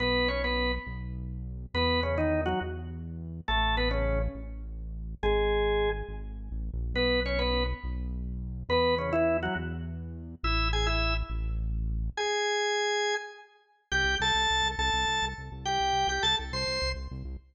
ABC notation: X:1
M:12/8
L:1/16
Q:3/8=138
K:Bmix
V:1 name="Drawbar Organ"
[B,B]4 [Cc]2 [B,B]4 z14 | [B,B]4 [C,C]2 [D,D]4 [F,F]2 z12 | [A,A]4 [B,B]2 [C,C]4 z14 | [G,G]10 z14 |
[B,B]4 [Cc]2 [B,B]4 z14 | [B,B]4 [C,C]2 [E,E]4 [F,F]2 z12 | [Ee]4 [Gg]2 [Ee]4 z14 | [Gg]14 z10 |
[K:Cmix] [Gg]4 [Aa]8 [Aa]8 z4 | [Gg]6 [Gg]2 [Aa]2 z2 [cc']6 z6 |]
V:2 name="Synth Bass 1" clef=bass
B,,,12 B,,,12 | E,,12 E,,12 | A,,,12 A,,,12 | G,,,12 G,,,6 A,,,3 ^A,,,3 |
B,,,12 B,,,12 | E,,12 E,,12 | A,,,12 A,,,12 | z24 |
[K:Cmix] C,,2 C,,2 C,,2 C,,2 C,,2 C,,2 C,,2 C,,2 C,,2 C,,2 C,,2 C,,2- | C,,2 C,,2 C,,2 C,,2 C,,2 C,,2 C,,2 C,,2 C,,2 C,,2 C,,2 C,,2 |]